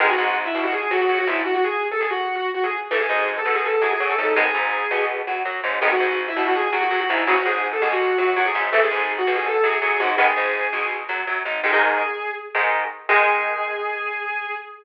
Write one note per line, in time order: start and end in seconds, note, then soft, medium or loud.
0.00 0.16 G#1 medium
0.00 0.07 D#3 loud
0.00 0.07 G#3 medium
0.00 0.07 B3 medium
0.00 0.09 G#4 loud
0.10 0.32 F#4 loud
0.18 0.49 G#1 medium
0.18 0.49 G#2 medium
0.45 0.61 E4 loud
0.54 0.86 B1 medium
0.54 0.85 B2 medium
0.64 0.72 F#4 medium
0.73 0.87 G#4 medium
0.91 1.06 F#2 medium
0.91 1.06 F#3 medium
0.91 1.00 F#4 medium
1.00 1.18 F#4 medium
1.09 1.25 F#2 medium
1.09 1.25 F#3 medium
1.18 1.27 F#4 loud
1.27 1.42 G#1 medium
1.27 1.43 G#2 medium
1.27 1.36 E4 medium
1.45 1.53 F#4 loud
1.55 1.63 F#4 medium
1.64 1.80 G#4 loud
1.92 2.00 A4 loud
2.01 2.09 G#4 medium
2.10 2.35 F#4 medium
2.35 2.44 F#4 medium
2.54 2.63 F#4 medium
2.64 2.72 G#4 medium
2.91 3.07 G#1 medium
2.91 2.98 E3 medium
2.91 2.98 A3 medium
2.91 2.99 A4 medium
3.00 3.23 G#4 medium
3.09 3.40 G#1 medium
3.09 3.40 G#2 medium
3.37 3.53 A4 medium
3.45 3.76 B1 medium
3.45 3.76 B2 medium
3.55 3.64 G#4 medium
3.64 3.82 A4 medium
3.81 3.97 F#2 medium
3.81 3.97 F#3 medium
3.81 3.90 G#4 medium
3.91 4.09 G#4 loud
4.00 4.16 F#2 medium
4.00 4.16 F#3 medium
4.09 4.17 A4 medium
4.18 4.34 G#1 medium
4.18 4.34 G#2 medium
4.18 4.27 A4 medium
4.36 4.52 G#1 medium
4.36 4.44 D#3 medium
4.36 4.44 G#3 medium
4.36 4.44 B3 medium
4.36 4.99 G#4 loud
4.54 4.85 G#1 medium
4.54 4.85 G#2 medium
4.91 5.22 B1 medium
4.91 5.22 B2 medium
5.27 5.43 F#2 medium
5.27 5.43 F#3 medium
5.45 5.60 F#2 medium
5.45 5.61 F#3 medium
5.63 5.79 G#1 medium
5.63 5.79 G#2 medium
5.81 5.97 G#1 medium
5.81 5.89 D#3 medium
5.81 5.89 G#3 medium
5.81 5.89 B3 medium
5.81 5.90 G#4 loud
5.91 6.15 F#4 loud
6.00 6.31 G#1 medium
6.00 6.31 G#2 medium
6.28 6.44 E4 loud
6.36 6.67 B1 medium
6.36 6.67 B2 medium
6.46 6.55 F#4 medium
6.55 6.72 G#4 loud
6.72 6.88 F#2 medium
6.72 6.88 F#3 medium
6.72 6.81 F#4 medium
6.82 7.00 F#4 loud
6.90 7.06 F#2 medium
6.90 7.06 F#3 medium
7.00 7.09 F#4 loud
7.09 7.25 G#1 medium
7.09 7.25 G#2 medium
7.09 7.18 E4 medium
7.27 7.43 G#1 medium
7.27 7.34 C#3 medium
7.27 7.34 F#3 medium
7.27 7.36 F#4 loud
7.36 7.45 F#4 loud
7.45 7.77 G#1 medium
7.45 7.76 G#2 medium
7.45 7.60 G#4 loud
7.73 7.81 A4 medium
7.82 8.12 B1 medium
7.82 8.13 B2 medium
7.82 7.90 G#4 medium
7.92 8.14 F#4 medium
8.18 8.34 F#2 medium
8.18 8.34 F#3 medium
8.18 8.27 F#4 medium
8.36 8.52 F#2 medium
8.36 8.52 F#3 medium
8.36 8.45 F#4 loud
8.46 8.54 G#4 loud
8.54 8.70 G#1 medium
8.54 8.70 G#2 medium
8.72 8.89 G#1 medium
8.72 8.80 E3 medium
8.72 8.80 A3 medium
8.72 8.81 A4 loud
8.82 9.05 G#4 medium
8.91 9.22 G#1 medium
8.91 9.22 G#2 medium
9.18 9.33 F#4 loud
9.27 9.58 B1 medium
9.27 9.58 B2 medium
9.36 9.45 G#4 loud
9.46 9.63 A4 medium
9.63 9.79 F#2 medium
9.63 9.79 F#3 medium
9.63 9.72 G#4 medium
9.73 9.90 G#4 loud
9.82 9.97 F#2 medium
9.82 9.97 F#3 medium
9.90 9.99 G#4 medium
10.00 10.15 G#1 medium
10.00 10.15 G#2 medium
10.00 10.08 F#4 medium
10.17 10.33 G#1 medium
10.17 10.25 D#3 medium
10.17 10.25 G#3 medium
10.17 10.25 B3 medium
10.17 10.88 G#4 loud
10.36 10.68 G#1 medium
10.36 10.67 G#2 medium
10.73 11.04 B1 medium
10.73 11.04 B2 medium
11.09 11.24 F#2 medium
11.09 11.24 F#3 medium
11.27 11.43 F#2 medium
11.27 11.43 F#3 medium
11.45 11.61 G#1 medium
11.45 11.61 G#2 medium
11.63 11.71 G#2 medium
11.63 11.71 D#3 medium
11.63 11.71 G#3 medium
11.63 12.27 G#4 loud
11.73 12.02 G#2 medium
11.73 12.02 D#3 medium
11.73 12.02 G#3 medium
12.55 12.84 G#2 medium
12.55 12.84 D#3 medium
12.55 12.84 G#3 medium
13.09 14.50 D#3 medium
13.09 14.50 G#3 loud
13.09 14.50 G#4 loud